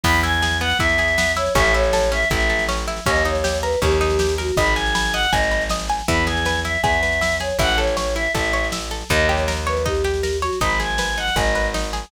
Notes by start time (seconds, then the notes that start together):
0.04 E2 B3 B5, kick, snare, crash
0.14 snare
0.23 E4 G#5, snare
0.34 snare
0.42 G#4, snare
0.51 snare
0.61 B3 F#5, snare
0.70 snare
0.79 E2 E4 E5, kick, snare
0.89 snare
0.98 G#4, snare
1.08 snare
1.18 B3, snare
1.26 snare
1.36 E4 C#5, snare
1.46 snare
1.55 A1 C#4 E5, kick, snare
1.64 snare
1.74 E4 C#5, snare
1.83 snare
1.93 A4, snare
2.03 snare
2.12 C#4 E5, snare
2.22 snare
2.30 A1 E4 E5, kick, snare
2.40 snare
2.49 A4, snare
2.59 snare
2.69 C#4, snare
2.78 snare
2.88 E4, snare
2.96 snare
3.06 D#2 C#4 D#5, kick, snare
3.16 snare
3.25 D#4 C#5, snare
3.35 snare
3.44 G4, snare
3.54 snare
3.62 A#4 B4, snare
3.72 snare
3.82 D#2 C#4 G4, kick, snare
3.91 snare
4.01 D#4, snare
4.10 snare
4.19 G4, snare
4.29 snare
4.38 F#4 A#4, snare
4.48 snare
4.57 G#1 D#5 B5, kick, snare
4.66 snare
4.76 G#5, snare
4.86 snare
4.95 B5, snare
5.05 snare
5.13 D#5 F#5, snare
5.23 snare
5.32 G#1 D#5 G#5, kick, snare
5.42 snare
5.51 B5, snare
5.61 snare
5.70 D#5, snare
5.80 snare
5.89 G#5, snare
5.99 snare
6.08 E2 E4 B5, kick, snare
6.17 snare
6.26 G#4 G#5, snare
6.36 snare
6.45 B4, snare
6.55 snare
6.64 E4 E5, snare
6.75 snare
6.82 E2 G#4 E5, kick, snare
6.93 snare
7.03 B4, snare
7.12 snare
7.21 E4, snare
7.31 snare
7.40 G#4 C#5, snare
7.49 snare
7.59 A1 E4 F#5, kick, snare
7.69 snare
7.78 A4 C#5, snare
7.87 snare
7.97 C#5, snare
8.06 snare
8.15 E4 E5, snare
8.25 snare
8.35 A1 A4 E5, kick, snare
8.44 snare
8.53 C#5, snare
8.64 snare
8.72 E4, snare
8.81 snare
8.91 A4, snare
9.01 snare
9.09 D#2 D#4 D#5, kick, snare
9.19 snare
9.29 G4 C#5, snare
9.37 snare
9.48 A#4, snare
9.57 snare
9.67 B4 C#5, snare
9.77 snare
9.85 D#4 G4, kick, snare
9.95 snare
10.04 G4, snare
10.14 snare
10.23 A#4, snare
10.33 snare
10.42 F#4 C#5, snare
10.53 snare
10.61 G#1 D#4 B5, kick, snare
10.70 snare
10.80 G#4 G#5, snare
10.90 snare
10.98 B4, snare
11.08 snare
11.17 D#4 F#5, snare
11.27 snare
11.36 G#1 G#4 D#5, kick, snare
11.46 snare
11.55 B4, snare
11.64 snare
11.74 D#4, snare
11.84 snare
11.93 G#4, snare
12.03 snare